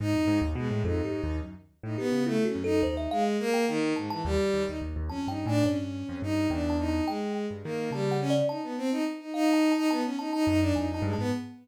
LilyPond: <<
  \new Staff \with { instrumentName = "Violin" } { \time 5/8 \tempo 4 = 106 dis'8. r16 gis8 dis'4 | r8. dis'16 b8 \tuplet 3/2 { a8 cis'8 dis'8 } | dis'8 gis8 ais8 dis8 gis,16 e16 | g8. dis'16 r8 \tuplet 3/2 { cis'8 dis'8 d'8 } |
cis'4 dis'8 d'8 dis'8 | gis8. r16 ais8 g8 cis'16 r16 | dis'16 b16 c'16 dis'16 r16 dis'16 dis'8. dis'16 | b16 cis'16 dis'16 dis'16 dis'16 d'16 dis'16 dis'16 gis16 b16 | }
  \new Staff \with { instrumentName = "Kalimba" } { \time 5/8 r4. \tuplet 3/2 { a'8 g'8 dis'8 } | r4 g'8 \tuplet 3/2 { e'8 fis'8 a'8 } | c''16 e''16 f''16 r8 g''16 r8 a''16 a''16 | r4. \tuplet 3/2 { a''8 g''8 gis''8 } |
cis''4 r8 \tuplet 3/2 { g''8 a''8 a''8 } | g''8 r4 \tuplet 3/2 { a''8 fis''8 d''8 } | a''4 r8 \tuplet 3/2 { f''8 a''8 a''8 } | a''16 r16 a''16 a''16 r8 \tuplet 3/2 { gis''8 a''8 a''8 } | }
  \new Staff \with { instrumentName = "Acoustic Grand Piano" } { \clef bass \time 5/8 gis,16 f,16 gis,16 dis,16 b,16 a,16 \tuplet 3/2 { f,8 gis,8 dis,8 } | fis,16 r8 a,16 dis16 cis8 r16 fis,8 | dis,8 r2 | dis,16 dis,16 dis,16 dis,16 dis,16 dis,16 \tuplet 3/2 { f,8 g,8 a,8 } |
g,8. f,16 g,8 e,4 | r8. g,16 dis8 cis4 | r2 r8 | r4 fis,8 f,8 g,16 gis,16 | }
>>